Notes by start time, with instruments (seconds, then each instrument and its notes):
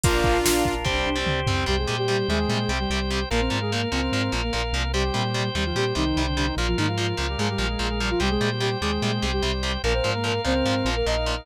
0.03 synth bass 1 A#1, overdriven guitar F3 A#3, lead 2 (sawtooth) D4 F4, ocarina F4, drawbar organ F4 A#4, kick, closed hi-hat
0.24 synth bass 1 A#1, kick
0.44 synth bass 1 A#1, ocarina F4, snare
0.65 synth bass 1 A#1, ocarina D4, kick
0.85 synth bass 1 C2, overdriven guitar G3 C4, drawbar organ G4 C5, kick
1.06 synth bass 1 C2
1.16 overdriven guitar G3 C4
1.26 synth bass 1 D2, mid tom
1.47 synth bass 1 C#2, overdriven guitar G3 C4, floor tom
1.66 synth bass 1 C2, overdriven guitar C3 G3, ocarina G3 G4, drawbar organ C5 G5
1.78 ocarina G#3 G#4
1.87 synth bass 1 A#2, overdriven guitar C3 G3
1.98 ocarina G3 G4
2.08 overdriven guitar C3 G3, ocarina G3 G4
2.28 synth bass 1 D#2, overdriven guitar C3 G3, ocarina G#3 G#4
2.48 synth bass 1 A#2, overdriven guitar C3 G3
2.68 synth bass 1 C2, overdriven guitar C3 G3
2.80 ocarina G3 G4
2.90 synth bass 1 C2, overdriven guitar C3 G3, ocarina G3 G4
3.11 overdriven guitar C3 G3
3.31 synth bass 1 A#1, overdriven guitar A#2 F3, ocarina A#3 A#4, drawbar organ A#4 F5
3.41 ocarina C4 C5
3.50 synth bass 1 G#2, overdriven guitar A#2 F3
3.61 ocarina G#3 G#4
3.71 overdriven guitar A#2 F3, ocarina A#3 A#4
3.91 synth bass 1 C#2, overdriven guitar A#2 F3, ocarina C4 C5
4.12 synth bass 1 G#2, overdriven guitar A#2 F3
4.32 synth bass 1 A#1, overdriven guitar A#2 F3
4.43 ocarina A#3 A#4
4.53 synth bass 1 A#1, overdriven guitar A#2 F3, ocarina A#3 A#4
4.73 synth bass 1 C2, overdriven guitar A#2 F3
4.93 overdriven guitar C3 G3, ocarina G3 G4, drawbar organ C5 G5
5.14 synth bass 1 A#2, overdriven guitar C3 G3
5.34 overdriven guitar C3 G3
5.55 synth bass 1 D#2, overdriven guitar C3 G3, ocarina G3 G4
5.66 ocarina F3 F4
5.75 synth bass 1 A#2, overdriven guitar C3 G3, ocarina G3 G4
5.95 synth bass 1 C2, overdriven guitar C3 G3, ocarina D#3 D#4
6.16 synth bass 1 C2, overdriven guitar C3 G3
6.26 ocarina D3 D4
6.37 overdriven guitar C3 G3, ocarina D3 D4
6.47 ocarina D#3 D#4
6.57 synth bass 1 A#1, overdriven guitar A#2 F3, ocarina F3 F4, drawbar organ A#4 F5
6.67 ocarina F3 F4
6.78 synth bass 1 G#2, overdriven guitar A#2 F3, ocarina D#3 D#4
6.87 ocarina F3 F4
6.98 overdriven guitar A#2 F3, ocarina F3 F4
7.17 synth bass 1 C#2, overdriven guitar A#2 F3, ocarina F3 F4
7.29 ocarina G3 G4
7.38 synth bass 1 G#2, overdriven guitar A#2 F3, ocarina G#3 G#4
7.49 ocarina G3 G4
7.58 synth bass 1 A#1, overdriven guitar A#2 F3
7.69 ocarina G#3 G#4
7.79 synth bass 1 A#1, overdriven guitar A#2 F3
7.89 ocarina G#3 G#4
8.00 overdriven guitar A#2 F3, ocarina G3 G4
8.10 ocarina F3 F4
8.20 synth bass 1 C2, overdriven guitar C3 G3, ocarina G3 G4, drawbar organ C5 G5
8.30 ocarina G#3 G#4
8.41 synth bass 1 A#2, overdriven guitar C3 G3
8.51 ocarina G3 G4
8.60 overdriven guitar C3 G3, ocarina G3 G4
8.81 synth bass 1 D#2, overdriven guitar C3 G3, ocarina G#3 G#4
9.02 synth bass 1 A#2, overdriven guitar C3 G3
9.22 synth bass 1 C2, overdriven guitar C3 G3
9.32 ocarina G3 G4
9.43 synth bass 1 C2, overdriven guitar C3 G3, ocarina G3 G4
9.63 overdriven guitar C3 G3
9.84 synth bass 1 A#1, overdriven guitar A#2 F3, ocarina A#3 A#4, drawbar organ A#4 F5
9.93 ocarina C4 C5
10.04 synth bass 1 G#2, overdriven guitar A#2 F3
10.15 ocarina A#3 A#4
10.24 overdriven guitar A#2 F3, ocarina A#3 A#4
10.45 synth bass 1 C#2, overdriven guitar A#2 F3, ocarina C4 C5
10.65 synth bass 1 G#2, overdriven guitar A#2 F3
10.85 synth bass 1 A#1, overdriven guitar A#2 F3
10.96 ocarina A#3 A#4
11.06 synth bass 1 A#1, overdriven guitar A#2 F3, ocarina D#4 D#5
11.26 overdriven guitar A#2 F3